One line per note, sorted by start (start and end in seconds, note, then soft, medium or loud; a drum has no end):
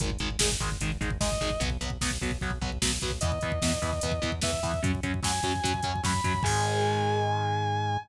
0.00 0.17 G#1 medium
0.00 0.09 D#3 loud
0.00 0.09 G#3 loud
0.00 kick loud
0.00 closed hi-hat loud
0.10 kick medium
0.19 0.37 G#1 medium
0.19 0.28 D#3 medium
0.19 0.28 G#3 medium
0.19 kick medium
0.19 closed hi-hat medium
0.30 kick medium
0.39 0.57 G#1 medium
0.39 0.48 D#3 medium
0.39 0.48 G#3 loud
0.39 kick medium
0.39 snare loud
0.52 kick medium
0.60 0.77 G#1 medium
0.60 0.68 D#3 loud
0.60 0.68 G#3 loud
0.60 kick medium
0.60 closed hi-hat medium
0.72 kick medium
0.81 0.98 G#1 medium
0.81 0.89 D#3 loud
0.81 0.89 G#3 medium
0.81 kick medium
0.81 closed hi-hat medium
0.92 kick medium
1.01 1.18 G#1 medium
1.01 1.09 D#3 medium
1.01 1.09 G#3 medium
1.01 kick medium
1.01 closed hi-hat medium
1.10 kick medium
1.21 1.38 G#1 medium
1.21 1.29 D#3 medium
1.21 1.29 G#3 medium
1.21 1.60 D#5 medium
1.21 kick medium
1.21 snare medium
1.32 kick medium
1.41 1.58 G#1 medium
1.41 1.49 D#3 medium
1.41 1.49 G#3 medium
1.41 kick medium
1.41 closed hi-hat medium
1.50 kick medium
1.60 1.78 B1 medium
1.60 1.68 F#3 loud
1.60 1.68 B3 loud
1.60 kick medium
1.60 closed hi-hat medium
1.70 kick medium
1.81 1.98 B1 medium
1.81 1.89 F#3 medium
1.81 1.89 B3 medium
1.81 kick medium
1.81 closed hi-hat medium
1.90 kick medium
2.01 2.18 B1 medium
2.01 2.10 F#3 medium
2.01 2.10 B3 loud
2.01 kick medium
2.01 snare loud
2.11 kick medium
2.21 2.38 B1 medium
2.21 2.30 F#3 loud
2.21 2.30 B3 medium
2.21 kick medium
2.21 closed hi-hat medium
2.31 kick medium
2.41 2.59 B1 medium
2.41 2.50 F#3 loud
2.41 2.50 B3 medium
2.41 kick medium
2.41 closed hi-hat soft
2.51 kick medium
2.61 2.79 B1 medium
2.61 2.70 F#3 medium
2.61 2.70 B3 loud
2.61 kick medium
2.72 kick medium
2.82 2.99 B1 medium
2.82 2.90 F#3 loud
2.82 2.90 B3 medium
2.82 kick medium
2.82 snare loud
2.91 kick medium
3.01 3.19 B1 medium
3.01 3.10 F#3 loud
3.01 3.10 B3 loud
3.01 kick medium
3.01 closed hi-hat medium
3.11 kick medium
3.21 3.39 E2 medium
3.21 3.30 E3 loud
3.21 3.30 B3 loud
3.21 4.31 D#5 soft
3.21 kick loud
3.21 closed hi-hat loud
3.32 kick medium
3.41 3.60 E2 medium
3.41 3.51 E3 loud
3.41 3.51 B3 medium
3.41 kick medium
3.41 closed hi-hat medium
3.52 kick medium
3.62 3.79 E2 medium
3.62 3.71 E3 medium
3.62 3.71 B3 loud
3.62 kick medium
3.62 snare loud
3.74 kick medium
3.82 4.00 E2 medium
3.82 3.90 E3 loud
3.82 3.90 B3 loud
3.82 kick medium
3.82 closed hi-hat medium
3.93 kick medium
4.01 4.20 E2 medium
4.01 4.11 E3 medium
4.01 4.11 B3 loud
4.01 kick medium
4.01 closed hi-hat loud
4.12 kick medium
4.22 4.41 E2 medium
4.22 4.30 E3 loud
4.22 4.30 B3 medium
4.22 kick medium
4.22 closed hi-hat medium
4.32 kick medium
4.42 4.60 E2 medium
4.42 4.50 E3 medium
4.42 4.50 B3 loud
4.42 4.81 E5 medium
4.42 kick medium
4.42 snare loud
4.53 kick medium
4.63 4.80 E2 medium
4.63 4.71 E3 medium
4.63 4.71 B3 medium
4.63 kick medium
4.63 closed hi-hat medium
4.74 kick medium
4.83 5.00 F#2 medium
4.83 4.91 F#3 loud
4.83 4.91 C#4 loud
4.83 kick loud
4.83 closed hi-hat medium
4.95 kick medium
5.03 5.20 F#2 medium
5.03 5.11 F#3 medium
5.03 5.11 C#4 medium
5.03 kick medium
5.03 closed hi-hat medium
5.14 kick medium
5.23 5.41 F#2 medium
5.23 5.31 F#3 medium
5.23 5.31 C#4 medium
5.23 6.01 G#5 medium
5.23 kick medium
5.23 snare loud
5.43 5.61 F#2 medium
5.43 5.52 F#3 medium
5.43 5.52 C#4 medium
5.43 kick medium
5.43 closed hi-hat medium
5.55 kick medium
5.64 5.81 F#2 medium
5.64 5.72 F#3 medium
5.64 5.72 C#4 medium
5.64 kick medium
5.64 closed hi-hat loud
5.74 kick medium
5.83 6.01 F#2 medium
5.83 5.92 F#3 medium
5.83 5.92 C#4 medium
5.83 kick medium
5.83 closed hi-hat medium
5.96 kick medium
6.03 6.21 F#2 medium
6.03 6.11 F#3 medium
6.03 6.11 C#4 medium
6.03 6.46 B5 medium
6.03 kick medium
6.03 snare medium
6.14 kick medium
6.24 6.41 F#2 medium
6.24 6.32 F#3 medium
6.24 6.32 C#4 medium
6.24 kick medium
6.24 closed hi-hat medium
6.34 kick medium
6.43 7.97 G#2 loud
6.43 7.97 D#3 loud
6.43 7.97 G#3 loud
6.43 7.97 G#5 loud
6.43 kick loud
6.43 crash loud